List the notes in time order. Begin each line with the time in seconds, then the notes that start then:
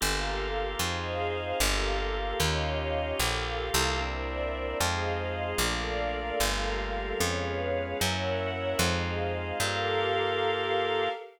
0.00 G1 A#3 F4 G4 A4 A#4 F5
0.79 F2 C4 D#4 F4 G#4 C5 D#5 F5
1.59 G1 A#3 F4 G4 A4 A#4 F5
2.40 D#2 C#4 D#4 F4 G4 C#5 D#5 F5
3.19 A#1 A#3 F4 G4 A4 A#4 F5
3.74 C2
4.00 A#3 C4 D4 E4 A#4 C5 D5 E5
4.80 F2 G#3 C4 D#4 F4 G#4 C5 D#5 F5
5.58 A#1 A3 A#3 D4 F4 A4 A#4 D5 F5
6.40 G1 G3 A3 A#3 F4 G4 A4 A#4 F5
7.19 F2 G#3 B3 C#4 F4 G#4 B4 C#5 F5
8.00 F#2 A#3 C#4 E4 F#4 A#4 C#5 E5 F#5
8.79 F2 G#3 C4 D#4 F4 G#4 C5 D#5 F5
9.60 G2 A#3 F4 G4 A4 A#4 F5